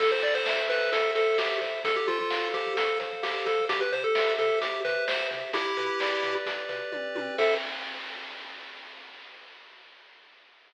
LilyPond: <<
  \new Staff \with { instrumentName = "Lead 1 (square)" } { \time 4/4 \key a \minor \tempo 4 = 130 a'16 c''16 d''16 c''8. b'8 a'8 a'8 g'8 r8 | a'16 g'16 f'16 f'8. g'8 a'8 r8 g'8 a'8 | g'16 b'16 c''16 a'8. a'8 g'8 b'8 c''8 r8 | <e' g'>2 r2 |
a'4 r2. | }
  \new Staff \with { instrumentName = "Lead 1 (square)" } { \time 4/4 \key a \minor a'8 c''8 e''8 c''8 a'8 c''8 e''8 c''8 | a'8 c''8 f''8 c''8 a'8 c''8 f''8 c''8 | g'8 c''8 e''8 c''8 g'8 c''8 e''8 c''8 | g'8 b'8 d''8 b'8 g'8 b'8 d''8 b'8 |
<a' c'' e''>4 r2. | }
  \new Staff \with { instrumentName = "Synth Bass 1" } { \clef bass \time 4/4 \key a \minor a,,8 a,8 a,,8 a,8 a,,8 a,8 a,,8 a,8 | f,8 f8 f,8 f8 f,8 f8 f,8 f8 | c,8 c8 c,8 c8 c,8 c8 c,8 c8 | b,,8 b,8 b,,8 b,8 b,,8 b,8 b,,8 b,8 |
a,4 r2. | }
  \new DrumStaff \with { instrumentName = "Drums" } \drummode { \time 4/4 <cymc bd>4 sn8 hh8 <hh bd>8 hh8 sn8 <hh bd>8 | <hh bd>8 hh8 sn8 <hh bd>8 <hh bd>8 <hh bd>8 sn8 <hh bd>8 | <hh bd>8 hh8 sn8 hh8 <hh bd>8 <hh bd>8 sn8 <hh bd>8 | <hh bd>8 hh8 sn8 <hh bd>8 <hh bd>8 <hh bd>8 <bd tommh>8 tommh8 |
<cymc bd>4 r4 r4 r4 | }
>>